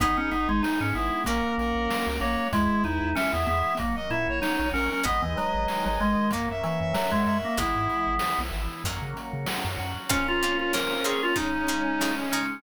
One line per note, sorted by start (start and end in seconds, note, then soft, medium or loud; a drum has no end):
0.00 0.16 G#1 medium
0.00 0.94 B3 medium
0.00 0.62 B3 medium
0.00 0.17 B3 loud
0.00 1.25 B3 medium
0.00 0.63 D#4 medium
0.00 0.85 D#4 medium
0.00 1.25 D#4 medium
0.00 0.62 G#4 medium
0.00 1.25 G#4 medium
0.00 kick loud
0.00 closed hi-hat medium
0.17 0.31 C#4 medium
0.31 0.48 G#1 medium
0.31 0.48 B3 medium
0.31 1.22 D#4 medium
0.31 closed hi-hat medium
0.49 0.62 G#1 medium
0.49 0.62 G#3 medium
0.63 1.25 G#3 medium
0.63 1.25 B3 medium
0.63 0.79 D#4 medium
0.63 1.25 G#4 medium
0.63 1.24 G#4 medium
0.63 snare loud
0.81 0.93 G#2 medium
0.81 0.94 C#4 medium
0.94 1.11 G#1 medium
0.94 1.25 B3 medium
0.94 1.24 B3 medium
0.94 1.21 E4 medium
0.94 closed hi-hat medium
1.24 1.42 A#1 medium
1.24 1.88 A#3 medium
1.24 2.08 A#3 medium
1.24 2.21 A#3 medium
1.24 2.51 A#3 medium
1.24 1.88 C#4 medium
1.24 2.51 C#4 medium
1.24 1.88 F#4 medium
1.24 2.51 F#4 medium
1.24 1.54 A#4 medium
1.24 kick medium
1.24 closed hi-hat loud
1.58 1.74 A#1 medium
1.58 2.48 C#4 medium
1.58 2.18 A#4 medium
1.58 closed hi-hat medium
1.75 1.88 A#1 medium
1.89 2.52 F#3 medium
1.89 2.52 A#3 medium
1.89 2.52 F#4 medium
1.89 2.50 F#4 medium
1.89 snare loud
2.07 2.20 C#2 medium
2.20 2.37 A#1 medium
2.20 2.48 A#3 medium
2.20 2.51 A#3 medium
2.20 2.47 C#5 medium
2.20 closed hi-hat medium
2.53 2.68 E2 medium
2.53 3.47 G#3 medium
2.53 2.83 G#3 loud
2.53 3.16 G#3 medium
2.53 3.16 B3 medium
2.53 3.08 E4 medium
2.53 3.16 E4 medium
2.53 kick loud
2.53 closed hi-hat loud
2.84 3.00 E2 medium
2.84 3.75 B3 medium
2.84 3.15 D#4 medium
2.84 closed hi-hat medium
3.02 3.14 E2 medium
3.15 3.79 E3 medium
3.15 3.79 G#3 medium
3.15 3.32 C#4 loud
3.15 3.76 E4 medium
3.15 3.79 E4 medium
3.15 3.77 E5 medium
3.15 snare loud
3.33 3.46 E2 medium
3.33 3.46 B3 medium
3.46 3.63 E2 medium
3.46 3.78 G#3 medium
3.46 3.74 B3 loud
3.46 closed hi-hat medium
3.77 3.95 A#1 medium
3.77 4.73 F#3 medium
3.77 4.42 F#3 medium
3.77 3.96 A#3 medium
3.77 4.42 A#3 medium
3.77 4.42 C#4 medium
3.77 kick medium
3.77 closed hi-hat loud
3.96 4.09 D#5 medium
4.10 4.26 A#2 medium
4.10 5.01 A#3 medium
4.10 4.40 E4 medium
4.10 4.27 E5 medium
4.10 closed hi-hat medium
4.28 4.41 A#1 medium
4.28 4.70 C#5 medium
4.42 5.05 F#3 medium
4.42 5.03 C#4 medium
4.42 5.05 C#4 medium
4.42 4.69 D#4 medium
4.42 5.05 F#4 medium
4.42 snare loud
4.59 4.72 A#1 medium
4.73 4.89 A#1 medium
4.73 5.04 F#3 medium
4.73 4.90 C#4 loud
4.73 5.00 A#4 medium
4.73 open hi-hat medium
4.92 5.05 C#4 medium
5.03 5.21 G#1 medium
5.03 6.28 G#3 medium
5.03 5.68 G#3 medium
5.03 6.28 B3 medium
5.03 5.22 B3 loud
5.03 5.68 B3 medium
5.03 6.28 D#4 medium
5.03 5.68 D#4 medium
5.03 6.26 B4 loud
5.03 5.66 D#5 medium
5.03 kick medium
5.03 closed hi-hat medium
5.22 5.35 D#2 medium
5.22 5.36 E3 medium
5.37 5.85 F#3 loud
5.37 6.27 D#5 medium
5.37 closed hi-hat medium
5.54 5.67 G#1 medium
5.68 6.31 D#3 medium
5.68 6.31 G#3 medium
5.68 6.31 D#4 medium
5.68 6.28 D#5 medium
5.68 6.29 G#5 medium
5.68 snare medium
5.86 5.99 G#1 medium
5.86 6.00 F#3 medium
6.00 6.16 G#1 medium
6.00 6.31 G#3 loud
6.00 7.26 A#4 medium
6.00 closed hi-hat medium
6.31 6.48 F#2 medium
6.31 6.94 F#3 medium
6.31 7.57 F#3 medium
6.31 6.94 A#3 medium
6.31 6.49 A#3 medium
6.31 7.57 A#3 medium
6.31 6.94 C#4 medium
6.31 7.57 C#4 medium
6.31 kick medium
6.31 closed hi-hat loud
6.49 6.62 F#2 medium
6.49 6.62 E5 medium
6.63 6.93 E3 medium
6.63 7.54 C#5 medium
6.63 6.79 E5 medium
6.63 closed hi-hat medium
6.81 6.93 F#2 medium
6.81 7.21 E5 medium
6.94 7.11 F#3 medium
6.94 7.58 F#3 medium
6.94 7.58 C#4 medium
6.94 7.58 F#4 medium
6.94 7.55 F#5 medium
6.94 snare loud
7.12 7.25 F#2 medium
7.12 7.38 G#3 loud
7.26 7.42 F#2 medium
7.26 7.56 A#4 medium
7.26 7.53 E5 medium
7.26 closed hi-hat medium
7.45 7.58 A#3 medium
7.57 7.74 G#1 medium
7.57 8.81 E3 medium
7.57 8.20 E3 medium
7.57 8.20 G#3 medium
7.57 8.81 G#3 medium
7.57 8.20 B3 medium
7.57 8.81 B3 medium
7.57 8.40 B3 loud
7.57 8.14 E4 medium
7.57 kick loud
7.57 closed hi-hat loud
7.75 7.88 G#2 medium
7.89 closed hi-hat medium
8.07 8.19 G#1 medium
8.19 8.83 E3 medium
8.19 8.83 B3 medium
8.19 8.83 E4 medium
8.19 snare loud
8.39 8.51 B1 medium
8.52 8.68 G#1 medium
8.52 closed hi-hat medium
8.84 9.00 F#2 medium
8.84 9.46 F#3 medium
8.84 10.09 F#3 medium
8.84 9.47 A#3 medium
8.84 10.09 A#3 medium
8.84 9.46 C#4 medium
8.84 10.09 C#4 medium
8.84 kick medium
8.84 closed hi-hat medium
9.02 9.14 C#3 medium
9.17 closed hi-hat medium
9.33 9.46 C#3 medium
9.46 10.09 F#3 medium
9.46 10.09 C#4 medium
9.46 10.09 F#4 medium
9.46 snare loud
9.65 9.77 F#2 medium
9.78 9.94 F#2 medium
9.78 closed hi-hat medium
10.09 10.23 A#3 loud
10.09 11.36 A#3 medium
10.09 10.23 C4 loud
10.09 11.36 C4 medium
10.09 10.23 C#4 loud
10.09 10.27 C#4 loud
10.09 11.36 C#4 medium
10.09 12.35 C#4 medium
10.09 11.36 F4 medium
10.09 10.23 F4 medium
10.09 11.31 A#4 loud
10.09 kick loud
10.09 closed hi-hat loud
10.28 10.58 F4 loud
10.42 10.57 A#3 medium
10.42 10.57 C4 medium
10.42 10.57 C#4 medium
10.42 10.57 F4 medium
10.42 11.33 F5 medium
10.42 closed hi-hat medium
10.59 10.73 F4 medium
10.73 10.87 A#3 medium
10.73 10.87 C4 medium
10.73 10.87 C#4 medium
10.73 10.87 F4 medium
10.73 11.04 A#4 medium
10.73 11.34 C5 medium
10.73 snare loud
11.04 11.18 A#3 medium
11.04 11.18 C4 medium
11.04 11.18 C#4 medium
11.04 11.18 F4 medium
11.04 11.22 G#4 medium
11.04 11.35 C#5 medium
11.04 snare medium
11.04 closed hi-hat medium
11.23 11.36 F4 loud
11.36 11.50 C#3 loud
11.36 12.62 C#3 medium
11.36 12.62 G#3 medium
11.36 12.58 C#4 loud
11.36 11.50 D#4 medium
11.36 12.15 D#4 medium
11.36 12.62 D#4 medium
11.36 11.50 G#4 loud
11.36 kick medium
11.36 closed hi-hat medium
11.67 11.82 C#3 medium
11.67 11.82 D#4 medium
11.67 11.82 G#4 medium
11.67 12.31 G#5 loud
11.67 closed hi-hat medium
12.00 12.15 C#3 medium
12.00 12.15 D#4 medium
12.00 12.15 G#4 medium
12.00 12.60 D#5 medium
12.00 snare loud
12.32 12.47 C#3 medium
12.32 12.61 C#4 medium
12.32 12.47 D#4 medium
12.32 12.47 G#4 medium
12.32 12.62 G#5 medium
12.32 closed hi-hat medium